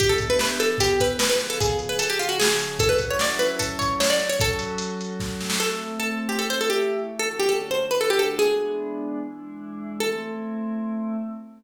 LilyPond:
<<
  \new Staff \with { instrumentName = "Pizzicato Strings" } { \time 4/4 \key e \dorian \tempo 4 = 150 g'16 a'8 b'16 b'16 r16 a'8 g'8 b'8 b'16 b'8 a'16 | \time 3/4 gis'8 r16 b'16 a'16 g'16 eis'16 fis'16 gis'4 | \time 4/4 a'16 b'8 cis''16 d''16 r16 b'8 a'8 cis''8 cis''16 d''8 cis''16 | \time 3/4 a'4. r4. |
\time 4/4 \key a \dorian a'4 a'8 r16 g'16 a'16 c''16 a'16 g'8. r8 | \time 3/4 a'16 r16 g'16 a'8 c''8 b'16 a'16 g'16 a'8 | \time 4/4 gis'2 r2 | \time 3/4 a'2. | }
  \new Staff \with { instrumentName = "Pad 5 (bowed)" } { \time 4/4 \key e \dorian <e b d' g'>4. <e b e' g'>4. <cis eis b gis'>4~ | \time 3/4 <cis eis b gis'>4 <cis eis cis' gis'>2 | \time 4/4 <fis cis' e' a'>2.~ <fis cis' e' a'>8 <fis cis' fis' a'>8~ | \time 3/4 <fis cis' fis' a'>2. |
\time 4/4 \key a \dorian <a c' e'>2 <e a e'>2 | \time 3/4 <d a cis' fis'>4. <d a d' fis'>4. | \time 4/4 <e gis b d'>2 <e gis d' e'>2 | \time 3/4 <a c' e'>2. | }
  \new DrumStaff \with { instrumentName = "Drums" } \drummode { \time 4/4 <hh bd>8 <hh bd>8 sn8 hh8 <hh bd>8 <hh bd>8 sn8 <hh sn>8 | \time 3/4 <hh bd>8 hh8 hh8 hh8 sn8 hh8 | \time 4/4 <hh bd>8 <hh bd>8 sn8 hh8 <hh bd>8 <hh bd>8 sn8 <hh sn>8 | \time 3/4 <hh bd>8 hh8 hh8 hh8 <bd sn>8 sn16 sn16 |
\time 4/4 r4 r4 r4 r4 | \time 3/4 r4 r4 r4 | \time 4/4 r4 r4 r4 r4 | \time 3/4 r4 r4 r4 | }
>>